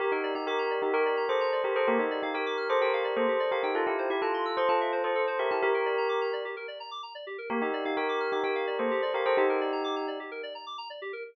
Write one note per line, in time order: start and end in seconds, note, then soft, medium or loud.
0.00 0.11 G4 loud
0.00 0.11 G4 medium
0.00 0.11 A#4 loud
0.12 0.33 D#4 medium
0.12 0.33 G4 loud
0.12 0.22 A#4 medium
0.24 0.34 D5 medium
0.35 0.46 D#4 medium
0.35 0.46 G4 loud
0.35 0.46 A#5 medium
0.47 0.79 G4 loud
0.47 0.79 A#4 loud
0.47 0.58 D6 medium
0.59 0.69 A#5 medium
0.71 0.81 D5 medium
0.82 0.93 D#4 medium
0.82 0.93 G4 loud
0.82 0.93 G4 medium
0.94 1.23 G4 loud
0.94 1.04 A#4 medium
0.94 1.23 A#4 loud
1.06 1.16 D5 medium
1.17 1.28 A#5 medium
1.29 1.59 A4 medium
1.29 1.59 C5 loud
1.29 1.39 D6 medium
1.41 1.51 A#5 medium
1.52 1.63 D5 medium
1.64 1.75 G4 medium
1.64 1.75 A#4 medium
1.76 1.87 A4 medium
1.76 1.86 A#4 medium
1.76 1.87 C5 loud
1.88 1.98 A#3 medium
1.88 1.99 G4 loud
1.88 1.99 A#4 loud
1.99 2.20 D#4 medium
1.99 2.20 G4 loud
1.99 2.10 G4 medium
2.11 2.21 D5 medium
2.23 2.34 D#4 medium
2.23 2.34 G4 medium
2.23 2.33 F5 medium
2.34 2.68 G4 medium
2.34 2.68 A#4 loud
2.34 2.45 G5 medium
2.46 2.57 D6 medium
2.57 2.68 F6 medium
2.69 2.81 A4 loud
2.69 2.81 C5 loud
2.69 2.80 D6 medium
2.81 3.14 G4 medium
2.81 3.14 A#4 loud
2.81 2.92 G5 medium
2.93 3.04 F5 medium
3.04 3.15 D5 medium
3.16 3.27 A#3 medium
3.16 3.49 A4 medium
3.16 3.49 C5 loud
3.28 3.39 G4 medium
3.40 3.50 D5 medium
3.51 3.63 G4 medium
3.51 3.63 A#4 loud
3.51 3.62 F5 medium
3.63 3.74 D#4 medium
3.63 3.74 G4 medium
3.63 3.74 G5 medium
3.75 3.86 F4 loud
3.75 3.86 F4 medium
3.75 3.86 A4 loud
3.86 4.09 E4 medium
3.86 4.09 G4 loud
3.86 3.97 A4 medium
3.99 4.09 C5 medium
4.10 4.21 E4 loud
4.10 4.21 G4 loud
4.10 4.21 E5 medium
4.22 4.52 F4 loud
4.22 4.52 A4 loud
4.22 4.33 A5 medium
4.34 4.45 C6 medium
4.45 4.56 E6 medium
4.57 4.68 A4 loud
4.57 4.68 C5 loud
4.57 4.68 C6 medium
4.69 4.99 F4 medium
4.69 4.99 A4 loud
4.69 4.79 A5 medium
4.81 4.91 E5 medium
4.92 5.03 C5 medium
5.04 5.15 F4 medium
5.04 5.38 A4 medium
5.04 5.38 C5 loud
5.15 5.26 A4 medium
5.27 5.38 C5 medium
5.39 5.50 G4 loud
5.39 5.50 A#4 loud
5.39 5.49 E5 medium
5.51 5.62 E4 medium
5.51 5.62 G4 loud
5.51 5.61 A5 medium
5.62 5.73 G4 medium
5.62 6.27 G4 loud
5.62 6.27 A#4 loud
5.74 5.85 A#4 medium
5.86 5.96 D5 medium
5.98 6.08 A#5 medium
6.09 6.20 D6 medium
6.21 6.32 A#5 medium
6.33 6.43 D5 medium
6.45 6.55 G4 medium
6.57 6.67 A#4 medium
6.68 6.79 D5 medium
6.80 6.91 A#5 medium
6.91 7.02 D6 medium
7.03 7.13 A#5 medium
7.15 7.25 D5 medium
7.27 7.37 G4 medium
7.38 7.49 A#4 medium
7.50 7.61 A#3 medium
7.50 7.61 G4 medium
7.50 7.61 A#4 loud
7.62 7.84 D#4 medium
7.62 7.84 G4 loud
7.62 7.72 G4 medium
7.73 7.84 D5 medium
7.85 7.96 D#4 medium
7.85 7.96 G4 medium
7.85 7.96 F5 medium
7.97 8.31 G4 loud
7.97 8.31 A#4 loud
7.97 8.07 G5 medium
8.09 8.19 D6 medium
8.20 8.31 F6 medium
8.32 8.43 D#4 medium
8.32 8.43 G4 loud
8.32 8.42 D6 medium
8.44 8.76 G4 medium
8.44 8.76 A#4 loud
8.44 8.54 G5 medium
8.55 8.66 F5 medium
8.67 8.78 D5 medium
8.79 8.90 A#3 medium
8.79 9.10 A4 medium
8.79 9.10 C5 medium
8.91 9.01 G4 medium
9.02 9.13 D5 medium
9.14 9.25 G4 loud
9.14 9.25 A#4 loud
9.14 9.25 F5 medium
9.25 9.37 A4 loud
9.25 9.37 C5 loud
9.25 9.36 G5 medium
9.37 10.06 D#4 loud
9.37 9.48 G4 medium
9.37 10.06 G4 loud
9.49 9.60 A#4 medium
9.61 9.71 D5 medium
9.72 9.83 A#5 medium
9.84 9.95 D6 medium
9.96 10.07 A#5 medium
10.08 10.18 D5 medium
10.20 10.30 G4 medium
10.31 10.42 A#4 medium
10.43 10.54 D5 medium
10.55 10.65 A#5 medium
10.67 10.77 D6 medium
10.78 10.88 A#5 medium
10.90 11.00 D5 medium
11.02 11.12 G4 medium
11.13 11.23 A#4 medium